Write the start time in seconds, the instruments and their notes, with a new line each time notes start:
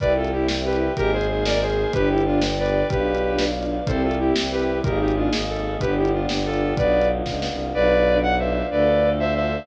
0.00 violin C2 B4 D5, string ensemble 1 C4 E4 G4, choir aahs C5 E5 G5, kick, closed hi-hat
0.16 violin F4 A4
0.24 string ensemble 1 C4 E4 G4, closed hi-hat
0.32 string ensemble 1 C4 E4 G4, violin E4 G4
0.48 snare
0.65 string ensemble 1 C4 E4 G4, violin G4 B4
0.73 closed hi-hat
0.88 string ensemble 1 C4 E4 G4
0.96 violin G#1 G4 A#4, string ensemble 1 A#3 D#4 G#4, choir aahs A#4 D#5 G#5, kick, closed hi-hat
1.13 violin G#4 C5
1.21 string ensemble 1 A#3 D#4 G#4, closed hi-hat
1.29 string ensemble 1 A#3 D#4 G#4, violin G#4 C5
1.45 violin A#4 D5, snare
1.61 string ensemble 1 A#3 D#4 G#4, violin G#4 C5
1.70 closed hi-hat
1.86 string ensemble 1 A#3 D#4 G#4
1.93 violin G1 G4 B4, string ensemble 1 B3 D4 G4, choir aahs B4 D5 G5, kick, closed hi-hat
2.10 violin E4 G4
2.18 string ensemble 1 B3 D4 G4, closed hi-hat
2.25 string ensemble 1 B3 D4 G4, violin D4 F4
2.42 snare
2.58 string ensemble 1 B3 D4 G4, violin B4 D5
2.66 closed hi-hat
2.82 string ensemble 1 B3 D4 G4
2.90 violin B1 G4 B4, string ensemble 1 B3 D4 F4, choir aahs B4 D5 F5, kick, closed hi-hat
3.15 string ensemble 1 B3 D4 F4, closed hi-hat
3.23 string ensemble 1 B3 D4 F4
3.39 snare
3.55 string ensemble 1 B3 D4 F4
3.63 closed hi-hat
3.80 string ensemble 1 B3 D4 F4
3.86 violin C2 A4 C5, string ensemble 1 C4 E4 G4, choir aahs C4 E4 G4, kick, closed hi-hat
4.03 violin F4 A4
4.11 string ensemble 1 C4 E4 G4, closed hi-hat
4.19 string ensemble 1 C4 E4 G4, violin E4 G4
4.36 violin C2, snare
4.51 string ensemble 1 C4 E4 G4, violin G4 B4
4.60 closed hi-hat
4.75 string ensemble 1 C4 E4 G4
4.84 violin G#1 G4 A#4, choir aahs A#3 D#4 G#4, string ensemble 1 A#3 D#4 G#4, kick, closed hi-hat
5.00 violin D#4 G4
5.08 string ensemble 1 A#3 D#4 G#4, closed hi-hat
5.16 string ensemble 1 A#3 D#4 G#4, violin D4 F4
5.32 violin G#1, snare
5.48 string ensemble 1 A#3 D#4 G#4, violin A4
5.56 closed hi-hat
5.73 string ensemble 1 A#3 D#4 G#4
5.80 violin G1 G4 B4, string ensemble 1 B3 D4 G4, choir aahs B3 D4 G4, kick, closed hi-hat
5.97 violin E4 G4
6.05 string ensemble 1 B3 D4 G4, closed hi-hat
6.13 string ensemble 1 B3 D4 G4, violin D4 F4
6.29 violin G1, snare
6.44 string ensemble 1 B3 D4 G4, violin F4 A4
6.54 closed hi-hat
6.69 string ensemble 1 B3 D4 G4
6.76 violin B1 B4 D5, string ensemble 1 B3 D4 F4, choir aahs B3 D4 F4, kick, closed hi-hat
7.01 string ensemble 1 B3 D4 F4, closed hi-hat
7.09 string ensemble 1 B3 D4 F4
7.26 violin C#2, kick, snare
7.42 string ensemble 1 B3 D4 F4, snare
7.50 violin C2
7.67 string ensemble 1 B3 D4 F4
7.73 violin B1 B4 D5, string ensemble 1 D4 F4 B4, choir aahs B4 D5 F5
7.98 string ensemble 1 D4 F4 B4
8.07 string ensemble 1 D4 F4 B4
8.23 violin F#5
8.38 string ensemble 1 D4 F4 B4, violin C5 E5
8.63 string ensemble 1 D4 F4 B4
8.70 violin D2 B4 D5, string ensemble 1 D4 F4 A4, choir aahs A4 D5 F5
8.95 string ensemble 1 D4 F4 A4
9.03 string ensemble 1 D4 F4 A4
9.19 violin C5 E5
9.35 string ensemble 1 D4 F4 A4, violin C5 E5
9.60 string ensemble 1 D4 F4 A4